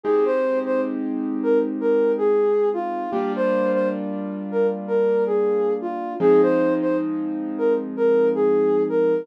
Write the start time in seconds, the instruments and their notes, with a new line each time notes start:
0.04 acoustic grand piano G#3 C4 D#4 G4, ocarina G#4
0.25 ocarina C5
0.66 ocarina C5
1.43 ocarina A#4
1.81 ocarina A#4
2.18 ocarina G#4
2.74 ocarina F4
3.11 acoustic grand piano G3 A#3 D4 F4, ocarina G4
3.36 ocarina C5
3.73 ocarina C5
4.52 ocarina A#4
4.87 ocarina A#4
5.26 ocarina G#4
5.81 ocarina F4
6.20 acoustic grand piano F3 G#3 C4 D#4, ocarina G#4
6.42 ocarina C5
6.82 ocarina C5
7.58 ocarina A#4
7.97 ocarina A#4
8.35 ocarina G#4
8.89 ocarina A#4